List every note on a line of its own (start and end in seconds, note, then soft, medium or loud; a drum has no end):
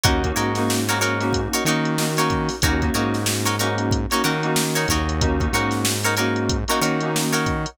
0.03 0.33 D#2 medium
0.03 0.20 A#3 medium
0.03 0.20 C#4 medium
0.03 0.20 D#4 medium
0.03 0.31 D#4 loud
0.03 0.20 F#4 medium
0.03 0.31 F#4 loud
0.03 0.31 A#4 loud
0.03 0.31 C#5 loud
0.03 kick loud
0.03 closed hi-hat medium
0.24 0.48 A#3 medium
0.24 0.48 C#4 medium
0.24 0.48 D#4 medium
0.24 0.48 F#4 medium
0.24 kick medium
0.24 closed hi-hat medium
0.36 1.48 G#2 medium
0.36 0.76 D#4 medium
0.36 0.76 F#4 medium
0.36 0.76 A#4 medium
0.36 0.76 C#5 medium
0.36 closed hi-hat medium
0.55 0.82 A#3 medium
0.55 0.82 C#4 medium
0.55 0.82 D#4 medium
0.55 0.82 F#4 medium
0.55 snare soft
0.55 closed hi-hat medium
0.70 snare medium
0.88 1.13 A#3 medium
0.88 1.13 C#4 medium
0.88 1.13 D#4 medium
0.88 0.99 D#4 loud
0.88 1.13 F#4 medium
0.88 0.99 F#4 medium
0.88 0.99 A#4 loud
0.88 0.99 C#5 medium
0.88 snare soft
0.88 closed hi-hat medium
1.01 1.41 D#4 medium
1.01 1.41 F#4 loud
1.01 1.41 A#4 loud
1.01 1.41 C#5 medium
1.01 closed hi-hat medium
1.20 1.58 A#3 medium
1.20 1.58 C#4 medium
1.20 1.58 D#4 medium
1.20 1.58 F#4 medium
1.20 snare soft
1.20 closed hi-hat medium
1.33 kick medium
1.33 closed hi-hat medium
1.53 1.64 D#4 medium
1.53 1.64 F#4 loud
1.53 1.64 A#4 medium
1.53 1.64 C#5 loud
1.53 closed hi-hat medium
1.65 2.50 D#3 medium
1.65 1.93 A#3 medium
1.65 1.93 C#4 medium
1.65 1.93 D#4 medium
1.65 2.06 D#4 loud
1.65 1.93 F#4 medium
1.65 2.06 F#4 medium
1.65 2.06 A#4 medium
1.65 2.06 C#5 medium
1.65 closed hi-hat medium
1.85 closed hi-hat medium
1.98 2.14 A#3 medium
1.98 2.14 C#4 medium
1.98 2.14 D#4 medium
1.98 2.14 F#4 medium
1.98 snare medium
2.17 2.55 A#3 medium
2.17 2.55 C#4 medium
2.17 2.55 D#4 medium
2.17 2.56 D#4 medium
2.17 2.55 F#4 medium
2.17 2.56 F#4 medium
2.17 2.56 A#4 medium
2.17 2.56 C#5 medium
2.17 closed hi-hat medium
2.30 kick medium
2.30 closed hi-hat medium
2.49 snare soft
2.49 open hi-hat medium
2.62 2.91 D#2 medium
2.62 2.78 A#3 medium
2.62 2.78 C#4 medium
2.62 2.78 D#4 medium
2.62 2.90 D#4 loud
2.62 2.78 F#4 medium
2.62 2.90 F#4 loud
2.62 2.90 A#4 loud
2.62 2.90 C#5 loud
2.62 kick medium
2.62 closed hi-hat medium
2.82 2.92 A#3 medium
2.82 2.92 C#4 medium
2.82 2.92 D#4 medium
2.82 2.92 F#4 medium
2.82 kick medium
2.82 closed hi-hat medium
2.94 4.07 G#2 medium
2.94 3.49 A#3 medium
2.94 3.49 C#4 medium
2.94 3.49 D#4 medium
2.94 3.34 D#4 medium
2.94 3.34 F#4 medium
2.94 3.49 F#4 medium
2.94 3.34 A#4 medium
2.94 3.34 C#5 loud
2.94 closed hi-hat medium
3.14 snare soft
3.14 closed hi-hat medium
3.26 snare loud
3.45 3.56 D#4 loud
3.45 3.56 F#4 medium
3.45 3.56 A#4 loud
3.45 3.56 C#5 medium
3.45 closed hi-hat medium
3.59 4.00 A#3 medium
3.59 4.00 C#4 medium
3.59 4.00 D#4 medium
3.59 3.99 D#4 medium
3.59 4.00 F#4 medium
3.59 3.99 F#4 medium
3.59 3.99 A#4 medium
3.59 3.99 C#5 medium
3.59 closed hi-hat medium
3.78 closed hi-hat medium
3.91 kick medium
3.91 closed hi-hat medium
4.11 4.22 A#3 medium
4.11 4.22 C#4 medium
4.11 4.22 D#4 medium
4.11 4.22 D#4 loud
4.11 4.22 F#4 medium
4.11 4.22 A#4 medium
4.11 4.22 C#5 medium
4.11 closed hi-hat medium
4.23 4.86 D#3 medium
4.23 4.39 A#3 medium
4.23 4.39 C#4 medium
4.23 4.39 D#4 medium
4.23 4.64 D#4 medium
4.23 4.39 F#4 medium
4.23 4.64 F#4 loud
4.23 4.64 A#4 medium
4.23 4.64 C#5 medium
4.23 snare soft
4.23 closed hi-hat medium
4.43 4.92 A#3 medium
4.43 4.92 C#4 medium
4.43 4.92 D#4 medium
4.43 4.92 F#4 medium
4.43 closed hi-hat medium
4.56 snare loud
4.75 4.88 D#4 medium
4.75 4.88 F#4 medium
4.75 4.88 A#4 medium
4.75 4.88 C#5 loud
4.75 closed hi-hat medium
4.88 5.49 D#2 medium
4.88 5.49 D#4 loud
4.88 5.49 F#4 loud
4.88 5.49 A#4 loud
4.88 5.49 C#5 loud
4.88 kick medium
4.88 closed hi-hat medium
5.09 closed hi-hat medium
5.21 5.37 A#3 medium
5.21 5.37 C#4 medium
5.21 5.37 D#4 loud
5.21 5.37 F#4 medium
5.21 kick medium
5.21 closed hi-hat medium
5.40 5.50 A#3 medium
5.40 5.50 C#4 medium
5.40 5.50 D#4 medium
5.40 5.50 F#4 medium
5.40 kick medium
5.40 closed hi-hat medium
5.52 6.65 G#2 medium
5.52 6.06 A#3 medium
5.52 6.06 C#4 medium
5.52 6.06 D#4 medium
5.52 5.94 D#4 medium
5.52 6.06 F#4 medium
5.52 5.94 F#4 loud
5.52 5.94 A#4 medium
5.52 5.94 C#5 medium
5.52 closed hi-hat medium
5.71 snare medium
5.71 closed hi-hat medium
5.85 snare loud
6.03 6.15 D#4 loud
6.03 6.15 F#4 medium
6.03 6.15 A#4 loud
6.03 6.15 C#5 medium
6.03 closed hi-hat medium
6.17 6.58 A#3 medium
6.17 6.58 C#4 medium
6.17 6.58 D#4 medium
6.17 6.57 D#4 medium
6.17 6.58 F#4 medium
6.17 6.57 F#4 medium
6.17 6.57 A#4 loud
6.17 6.57 C#5 loud
6.17 closed hi-hat medium
6.36 closed hi-hat medium
6.49 kick medium
6.49 closed hi-hat medium
6.68 6.79 A#3 medium
6.68 6.79 C#4 medium
6.68 6.79 D#4 medium
6.68 6.80 D#4 loud
6.68 6.79 F#4 medium
6.68 6.80 F#4 medium
6.68 6.80 A#4 medium
6.68 6.80 C#5 medium
6.68 closed hi-hat medium
6.81 7.66 D#3 medium
6.81 6.97 A#3 medium
6.81 6.97 C#4 medium
6.81 6.97 D#4 medium
6.81 7.21 D#4 medium
6.81 6.97 F#4 medium
6.81 7.21 F#4 medium
6.81 7.21 A#4 medium
6.81 7.21 C#5 loud
6.81 closed hi-hat medium
7.00 7.51 A#3 medium
7.00 7.51 C#4 medium
7.00 7.51 D#4 medium
7.00 7.51 F#4 medium
7.00 closed hi-hat medium
7.16 snare medium
7.33 7.70 D#4 medium
7.33 7.70 F#4 medium
7.33 7.70 A#4 medium
7.33 7.70 C#5 medium
7.33 closed hi-hat medium
7.46 kick medium
7.46 closed hi-hat medium
7.66 closed hi-hat medium